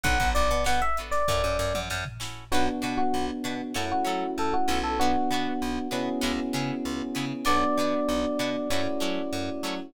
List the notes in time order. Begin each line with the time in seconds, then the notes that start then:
0.03 B1 B3 D4 F#4 A4 F#5, kick, closed hi-hat
0.20 B1 B3 D4 F#4 A4, kick, closed hi-hat
0.35 B1 D5, closed hi-hat
0.51 B2, closed hi-hat
0.64 B2 B3 D4 F#4 A4 F#5, snare
0.82 E5, closed hi-hat
0.97 B3 D4 F#4 A4, closed hi-hat
1.11 D5, snare, closed hi-hat
1.28 F#2 C#4 E4 F#4, kick, snare
1.32 A4
1.44 F#2
1.59 F#2, snare
1.74 F#2, mid tom
1.90 F#2, snare
2.05 floor tom
2.20 C#4 E4 F#4 A4, snare
2.52 B1 B3 D4 F#4 B4
2.82 B2 D4 F#4 B4
2.97 F#4
3.14 B1
3.44 B2 D4 F#4 B4
3.74 F#2 A3 C#4 E4 F#4 A4
3.91 F#4
4.05 F#3 C#4 E4 F#4 A4
4.38 F#2 A4
4.54 F#4
4.68 B1 C#4 E4 F#4 A4
4.84 A4
4.99 B3 D4 F#4
5.31 B2 B3 D4 F#4
5.62 B1
5.91 B2 B3 C#4 D4 E4 F#4 G#4
6.21 C#2 B3 C#4 E4 G#4
6.53 C#3 B3 C#4 E4 G#4
6.85 C#2
7.15 C#3 B3 C#4 E4 G#4
7.45 B1 B3 D4 F#4 D5
7.77 B2 B3 D4 F#4
8.09 B1
8.39 B2 B3 D4 F#4
8.70 F#2 A3 C#4 E4 F#4
9.00 F#3 A3 C#4 E4 F#4
9.33 F#2
9.63 F#3 A3 C#4 E4 F#4